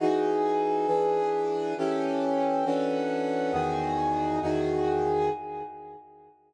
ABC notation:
X:1
M:4/4
L:1/8
Q:1/4=136
K:Emix
V:1 name="Brass Section"
[E,^DFG]4 [E,=DGB]4 | [E,C=GA]4 [E,CDFA]4 | [E,,^D,FG]4 [E,,D,FG]4 |]